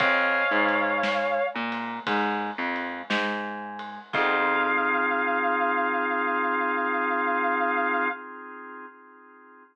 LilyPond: <<
  \new Staff \with { instrumentName = "Distortion Guitar" } { \time 4/4 \key f \minor \tempo 4 = 58 <des'' f''>4. r2 r8 | f''1 | }
  \new Staff \with { instrumentName = "Drawbar Organ" } { \time 4/4 \key f \minor <c'' ees'' f'' aes''>8 aes4 bes8 aes8 f8 aes4 | <c' ees' f' aes'>1 | }
  \new Staff \with { instrumentName = "Electric Bass (finger)" } { \clef bass \time 4/4 \key f \minor f,8 aes,4 bes,8 aes,8 f,8 aes,4 | f,1 | }
  \new DrumStaff \with { instrumentName = "Drums" } \drummode { \time 4/4 \tuplet 3/2 { <bd cymr>8 r8 cymr8 sn8 r8 cymr8 <bd cymr>8 r8 cymr8 sn8 r8 cymr8 } | <cymc bd>4 r4 r4 r4 | }
>>